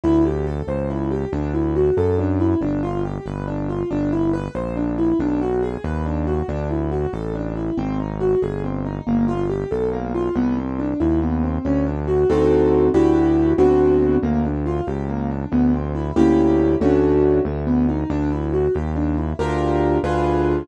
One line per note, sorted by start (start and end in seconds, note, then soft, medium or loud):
0.04 0.62 D2 loud
0.04 0.23 E4 medium
0.25 0.45 G4 medium
0.47 0.66 A4 medium
0.67 1.25 C#2 medium
0.67 0.87 C5 medium
0.90 1.09 E4 medium
1.11 1.30 G4 medium
1.33 1.91 D2 medium
1.33 1.52 D4 medium
1.54 1.73 E4 medium
1.76 1.95 F#4 medium
1.97 2.55 F#2 medium
1.97 2.17 A4 medium
2.19 2.38 D4 medium
2.40 2.59 E4 medium
2.61 3.19 G1 loud
2.61 2.81 D4 medium
2.83 3.02 F4 medium
3.04 3.24 G4 medium
3.26 3.84 G1 medium
3.26 3.45 B4 medium
3.47 3.67 D4 medium
3.69 3.89 F4 medium
3.91 4.49 G1 medium
3.91 4.10 D4 medium
4.12 4.32 E4 medium
4.33 4.53 B4 medium
4.55 5.13 A#1 medium
4.55 4.74 C5 medium
4.76 4.96 D4 medium
4.98 5.18 E4 medium
5.19 5.77 B1 medium
5.19 5.39 D4 medium
5.41 5.60 F#4 medium
5.63 5.82 G#4 medium
5.84 6.42 D#2 medium
5.84 6.04 B4 medium
6.06 6.25 D4 medium
6.27 6.46 F#4 medium
6.48 7.06 D2 medium
6.48 6.68 D4 medium
6.70 6.90 E4 medium
6.92 7.11 F#4 medium
7.13 7.71 A1 medium
7.13 7.33 A4 medium
7.35 7.54 D4 medium
7.56 7.75 E4 medium
7.77 8.35 G#1 medium
7.77 7.97 C4 loud
8.00 8.19 D#4 medium
8.20 8.40 F#4 medium
8.42 9.00 G1 medium
8.42 8.62 G#4 medium
8.64 8.83 C4 medium
8.85 9.05 D#4 medium
9.07 9.65 G1 medium
9.07 9.26 A#3 medium
9.28 9.47 F4 medium
9.49 9.69 G4 medium
9.71 10.30 B1 medium
9.71 9.90 A4 medium
9.92 10.12 A#3 medium
10.14 10.34 F4 medium
10.35 10.94 C2 loud
10.35 10.55 B3 medium
10.57 10.77 C4 medium
10.79 10.98 D4 medium
11.00 11.59 D#2 medium
11.00 11.19 E4 medium
11.22 11.41 B3 medium
11.43 11.63 C4 medium
11.65 12.24 D2 medium
11.65 11.84 C#4 medium
11.86 12.06 D4 medium
12.08 12.27 F#4 medium
12.30 12.89 D2 loud
12.30 12.88 C4 medium
12.30 12.88 D#4 medium
12.30 12.88 F#4 medium
12.30 12.88 A4 medium
12.94 13.53 D2 medium
12.94 13.52 D4 medium
12.94 13.52 E4 medium
12.94 13.52 F#4 medium
12.94 13.52 G4 medium
13.58 14.17 D2 loud
13.58 14.16 B3 medium
13.58 14.16 C4 medium
13.58 14.16 D4 medium
13.58 14.16 F#4 medium
14.23 14.81 D2 medium
14.23 14.42 A#3 medium
14.45 14.64 D4 medium
14.66 14.85 F4 medium
14.87 15.45 C#2 medium
14.87 15.06 G4 medium
15.09 15.28 A#3 medium
15.30 15.50 D4 medium
15.52 16.12 D2 medium
15.52 15.71 B3 medium
15.74 15.93 C4 medium
15.95 16.14 E4 medium
16.16 16.76 D2 loud
16.16 16.74 A#3 medium
16.16 16.74 C#4 medium
16.16 16.74 E4 medium
16.16 16.74 G4 loud
16.81 17.40 D2 medium
16.81 17.39 A3 loud
16.81 17.39 C#4 medium
16.81 17.39 D4 medium
16.81 17.39 F#4 medium
17.45 18.04 D2 medium
17.45 17.65 A3 medium
17.67 17.86 B3 medium
17.89 18.08 D#4 medium
18.10 18.68 D2 loud
18.10 18.29 D4 medium
18.32 18.51 E4 medium
18.53 18.72 F#4 medium
18.74 19.33 D#2 medium
18.74 18.94 G4 medium
18.96 19.15 D4 medium
19.17 19.37 E4 medium
19.39 19.98 D2 medium
19.39 19.97 D4 medium
19.39 19.97 F4 medium
19.39 19.97 G4 medium
19.39 19.97 A#4 medium
20.03 20.63 D2 loud
20.03 20.62 D4 medium
20.03 20.62 F4 medium
20.03 20.62 G#4 medium
20.03 20.62 B4 medium